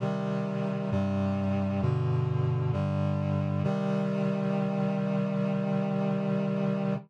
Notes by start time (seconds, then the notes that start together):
0.00 C3 D#3 G3
0.91 G2 C3 G3
1.82 G2 B2 D3
2.73 G2 D3 G3
3.64 C3 D#3 G3